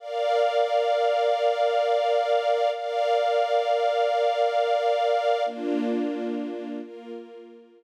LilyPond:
\new Staff { \time 4/4 \key bes \major \tempo 4 = 88 <bes' d'' f''>1 | <bes' d'' f''>1 | <bes d' f'>2 <bes f' bes'>2 | }